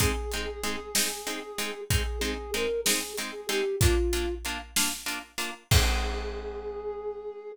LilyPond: <<
  \new Staff \with { instrumentName = "Flute" } { \time 6/8 \key aes \lydian \tempo 4. = 63 aes'2. | aes'8 aes'8 bes'8 aes'8 r16 aes'16 g'8 | f'4 r2 | aes'2. | }
  \new Staff \with { instrumentName = "Orchestral Harp" } { \time 6/8 \key aes \lydian <aes c' ees'>8 <aes c' ees'>8 <aes c' ees'>8 <aes c' ees'>8 <aes c' ees'>8 <aes c' ees'>8 | <aes c' ees'>8 <aes c' ees'>8 <aes c' ees'>8 <aes c' ees'>8 <aes c' ees'>8 <aes c' ees'>8 | <bes d' f'>8 <bes d' f'>8 <bes d' f'>8 <bes d' f'>8 <bes d' f'>8 <bes d' f'>8 | <aes c' ees'>2. | }
  \new DrumStaff \with { instrumentName = "Drums" } \drummode { \time 6/8 <hh bd>8 hh8 hh8 sn8 hh8 hh8 | <hh bd>8 hh8 hh8 sn8 hh8 hh8 | <hh bd>8 hh8 hh8 sn8 hh8 hh8 | <cymc bd>4. r4. | }
>>